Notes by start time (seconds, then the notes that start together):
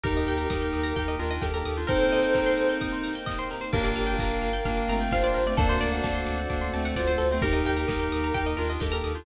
0.04 D#2 A#3 D#4 G4 A#4 D#5 G5, kick, closed hi-hat
0.17 D#5
0.27 D#2 G5, open hi-hat
0.38 A#5
0.50 D#2 A#4 D#6, kick, snare
0.62 G6
0.73 D#2 D#6, open hi-hat
0.83 A#5
0.95 D#2 D#4 G4 G5, kick, closed hi-hat
1.08 D#5
1.19 D#2 D4 F4 A#4, open hi-hat
1.31 D#5
1.42 D#2 G4 A4 A#4 G5, kick, snare
1.54 G4 A#4 A#5
1.65 D#2 D#6, open hi-hat
1.77 D4 F4 G6
1.87 A#3 C4 D#4 G4 A4 A#4 C5 D#5 G5, kick, closed hi-hat
2.00 C5
2.11 D#5, open hi-hat
2.23 G5
2.35 A#5, kick, clap
2.46 C6
2.57 D#6, open hi-hat
2.69 G6
2.81 D#6, kick, closed hi-hat
2.92 C6
3.04 A#5, open hi-hat
3.15 G5
3.26 D#5, kick, clap
3.39 C5
3.50 A#4, open hi-hat
3.61 C5
3.72 G1 A#3 D4 F4 G4 A#4 D5 F5 G5, kick, crash
3.84 D5
3.96 G1 F5, open hi-hat
4.07 G5
4.19 G1 A#4 A#5, kick, clap
4.31 D6
4.42 G1 F6, open hi-hat
4.53 G6
4.65 G1 A#3 D4 F6, kick, closed hi-hat
4.77 D6
4.88 G1 A3 C4 A#5, open hi-hat
5.01 G5
5.11 G1 D4 F4 C5 F5, kick, snare
5.23 D4 F4 D5
5.34 G1 A#4, open hi-hat
5.46 A3 C4 D5
5.57 D2 A3 A#3 C4 D4 F#4 A4 A#4 C5 D5 F#5, kick, closed hi-hat
5.69 C5
5.81 D2 D5, open hi-hat
5.93 F#5
6.02 D2 D5 A5, kick, snare
6.15 C6
6.26 D2 D6, open hi-hat
6.39 F#6
6.50 D2 A#3 D4 D6, kick, closed hi-hat
6.61 C6
6.73 D2 A3 C4 A5, open hi-hat
6.85 F#5
6.96 D2 F4 C5 D5, kick, snare
7.07 F4 C5
7.18 D2 A4, open hi-hat
7.31 A3 C4 C5
7.42 D#2 A#3 D#4 G4 A#4 D#5 G5, kick, closed hi-hat
7.53 D#5
7.65 D#2 G5, open hi-hat
7.77 A#5
7.87 D#2 A#4 D#6, kick, snare
8.00 G6
8.12 D#2 D#6, open hi-hat
8.24 A#5
8.34 D#2 D#4 G4 G5, kick, closed hi-hat
8.46 D#5
8.57 D#2 D4 F4 A#4, open hi-hat
8.70 D#5
8.80 D#2 G4 A4 A#4 G5, kick, snare
8.92 G4 A#4 A#5
9.04 D#2 D#6, open hi-hat
9.15 D4 F4 G6